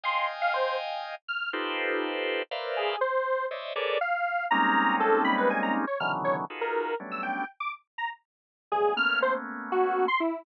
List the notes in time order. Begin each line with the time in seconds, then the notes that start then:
0.04 D#5 F5 G5 G#5 C6
0.42 F5
0.54 C5
1.28 F6
1.53 D#4 F4 G4 A4 B4 C5
2.51 A#4 B4 C5 D5 E5 F5
2.77 G#4
3.01 C5
3.51 C5 C#5 D5 D#5 E5
3.76 G#4 A4 A#4 B4 C#5 D5
4.01 F5
4.51 G3 G#3 A#3 C4 C#4 D#4 A#5
5.00 A4
5.24 B5
5.38 B4
5.50 G#5
5.63 A#5
5.87 C#5
6.00 B2 C#3 D3 D#3 E3 F#3 F6
6.24 C#5
6.50 D#4 F4 F#4 G#4 A4 B4
6.61 A#4
7.00 F#3 G3 A3 B3 C#4 D4
7.11 E6
7.23 G5
7.60 D6
7.98 A#5
8.72 F#2 G2 A2 B2 C#3 G#4
8.96 A3 A#3 B3 C#4 F6
9.22 C5
9.72 F#4
10.08 C6
10.20 E4